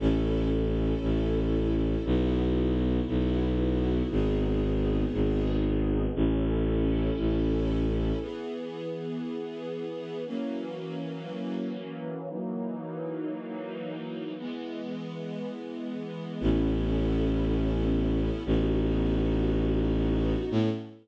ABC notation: X:1
M:4/4
L:1/8
Q:1/4=117
K:Alyd
V:1 name="String Ensemble 1"
[CEA]8 | [B,EF]8 | [B,DG]8 | [CEA]8 |
[K:Elyd] [E,B,G]8 | [E,F,A,C]8 | [E,F,A,D]8 | [E,G,B,]8 |
[K:Alyd] [B,CEA]8 | [B,DF]8 | [B,CEA]2 z6 |]
V:2 name="Violin" clef=bass
A,,,4 A,,,4 | B,,,4 B,,,4 | G,,,4 G,,,4 | A,,,4 A,,,4 |
[K:Elyd] z8 | z8 | z8 | z8 |
[K:Alyd] A,,,8 | A,,,8 | A,,2 z6 |]